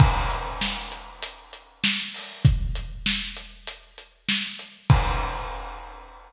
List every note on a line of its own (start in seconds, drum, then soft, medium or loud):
0.00 kick loud
0.00 crash loud
0.31 closed hi-hat medium
0.61 snare loud
0.92 closed hi-hat medium
1.23 closed hi-hat loud
1.53 closed hi-hat medium
1.84 snare loud
2.14 open hi-hat medium
2.45 kick loud
2.45 closed hi-hat loud
2.75 closed hi-hat medium
3.06 snare loud
3.37 closed hi-hat medium
3.67 closed hi-hat loud
3.98 closed hi-hat medium
4.29 snare loud
4.59 closed hi-hat medium
4.90 kick loud
4.90 crash loud